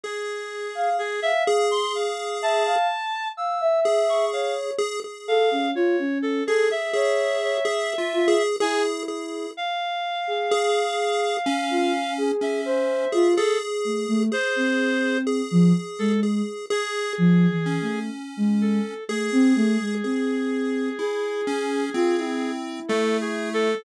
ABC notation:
X:1
M:5/4
L:1/16
Q:1/4=63
K:none
V:1 name="Ocarina"
z3 f z f2 z3 e f z2 f e3 _d2 | z2 A _D F D2 A z _d2 d z2 F z E4 | z3 _A2 z4 F z A2 c2 F z2 =A, A, | z C4 F, z _A,2 z3 (3F,2 E,2 =A,2 z _A,2 z |
A, C A, _A, C4 _A4 F E7 |]
V:2 name="Lead 1 (square)"
_A6 A6 z4 A4 | _A A3 z3 A A A3 (3A2 F2 A2 A2 A2 | z4 _A4 _D4 D3 A A4 | _A4 A4 A2 A2 z2 _D6 |
_A4 A4 E2 _D2 C4 =A,4 |]
V:3 name="Clarinet"
_A4 A e z c' f2 =a4 e'2 z _d' f z | z2 f2 _d2 A _A e8 _a z3 | f12 e4 A z3 | c4 z3 A z2 _A6 z2 =A2 |
_A16 (3=A2 _A2 =A2 |]